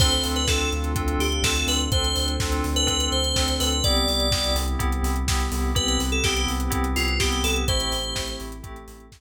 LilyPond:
<<
  \new Staff \with { instrumentName = "Electric Piano 2" } { \time 4/4 \key a \minor \tempo 4 = 125 c''16 c''16 r16 b'16 a'8 r4 g'8 a'8 b'16 r16 | c''8. r4 b'8. c''4 b'8 | d''4. r2 r8 | b'16 b'16 r16 a'16 g'8 r4 f'8 g'8 a'16 r16 |
c''4. r2 r8 | }
  \new Staff \with { instrumentName = "Electric Piano 2" } { \time 4/4 \key a \minor <c' d' f' a'>4 <c' d' f' a'>4 <c' d' f' a'>4 <c' d' f' a'>4 | <c' d' f' a'>4 <c' d' f' a'>4 <c' d' f' a'>4 <c' d' f' a'>4 | <b c' e' g'>4 <b c' e' g'>4 <b c' e' g'>4 <b c' e' g'>4 | <b c' e' g'>4 <b c' e' g'>4 <b c' e' g'>4 <b c' e' g'>4 |
<a c' e' g'>4 <a c' e' g'>4 <a c' e' g'>4 <a c' e' g'>4 | }
  \new Staff \with { instrumentName = "Synth Bass 2" } { \clef bass \time 4/4 \key a \minor d,8 d,8 d,8 d,8 d,8 d,8 d,8 d,8 | d,8 d,8 d,8 d,8 d,8 d,8 d,8 d,8 | c,8 c,8 c,8 c,8 c,8 c,8 c,8 c,8 | c,8 c,8 c,8 c,8 c,8 c,8 c,8 c,8 |
a,,8 a,,8 a,,8 a,,8 a,,8 a,,8 a,,8 r8 | }
  \new Staff \with { instrumentName = "Pad 2 (warm)" } { \time 4/4 \key a \minor <c' d' f' a'>1 | <c' d' a' c''>1 | <b c' e' g'>1 | <b c' g' b'>1 |
<a c' e' g'>2 <a c' g' a'>2 | }
  \new DrumStaff \with { instrumentName = "Drums" } \drummode { \time 4/4 <cymc bd>16 hh16 hho16 hh16 <bd sn>8 hh16 hh16 <hh bd>16 hh16 hho16 hh16 <bd sn>16 hh16 hho16 hh16 | <hh bd>16 hh16 hho16 hh16 <bd sn>16 hh16 hho16 hh16 <hh bd>16 hh16 hh16 hh16 <bd sn>16 hh16 hho16 hh16 | <hh bd>16 hh16 hho16 hh16 <bd sn>16 hh16 hho16 hh16 <hh bd>16 hh16 hho16 hh16 <bd sn>16 hh16 hho8 | <hh bd>16 hh16 hho16 hh16 <bd sn>16 hh16 hho16 hh16 <hh bd>16 hh16 hho16 hh16 <bd sn>16 hh16 hho16 hh16 |
<hh bd>16 hh16 hho16 hh16 <bd sn>16 hh16 hho16 hh16 <hh bd>16 hh16 hho16 hh16 <bd sn>4 | }
>>